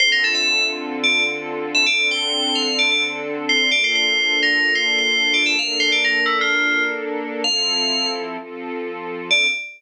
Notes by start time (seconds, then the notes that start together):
0.00 D3 C4 F4 A4 C5
0.12 A#4
0.24 A4
0.35 E5
1.04 D5
1.75 E5
1.86 D3 C4 D4 A4 D5
2.11 G5
2.55 F5
2.79 D5
2.91 D5
3.49 C5
3.72 A#3 D4 F4 A4 D5
3.84 C5
3.95 C5
4.43 A#4
4.75 C5
4.98 C5
5.34 D5
5.46 E5
5.58 A#3 D4 A4 A#4 F5
5.80 C5
5.92 D5
6.04 A#4
6.26 E4
6.41 F4
7.44 F3 C4 E4 A4 F5
8.38 F3 C4 F4 A4
9.30 D3 C4 F4 A4 D5